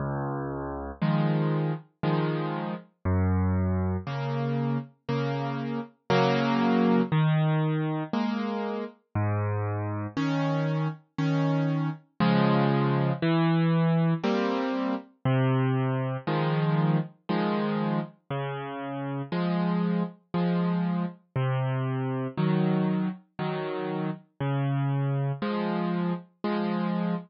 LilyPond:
\new Staff { \time 3/4 \key des \major \tempo 4 = 59 des,4 <ees f aes>4 <ees f aes>4 | ges,4 <des bes>4 <des bes>4 | <des ges bes>4 ees4 <aes bes>4 | aes,4 <ees des'>4 <ees des'>4 |
<des f aes>4 e4 <g bes c'>4 | c4 <ees f aes>4 <ees f aes>4 | des4 <f aes>4 <f aes>4 | c4 <ees ges>4 <ees ges>4 |
des4 <f aes>4 <f aes>4 | }